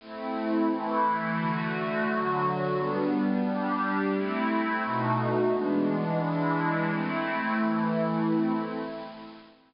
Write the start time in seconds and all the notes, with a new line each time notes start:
0.00 A3 C4 E4
0.70 E3 A3 E4
1.38 D3 A3 F#4
2.08 D3 F#3 F#4
2.76 G3 B3 D4
3.45 G3 D4 G4
4.13 A3 C4 E4
4.84 B2 A3 D#4 F#4
5.53 E3 G#3 B3 D4
6.22 E3 G#3 D4 E4
6.90 A3 C4 E4
7.59 E3 A3 E4
8.28 A3 C4 E4